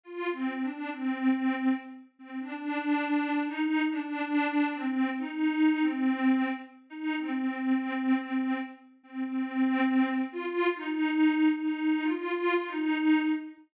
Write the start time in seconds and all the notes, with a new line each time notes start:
0.03 F4
0.32 C4
0.62 D4
0.91 C4
1.32 C4
2.19 C4
2.39 D4
3.47 D#4
3.89 D4
4.75 C4
5.18 D#4
5.81 C4
6.89 D#4
7.18 C4
7.46 C4
7.74 C4
8.18 C4
9.03 C4
9.26 C4
10.32 F4
10.75 D#4
11.61 D#4
12.03 F4
12.67 D#4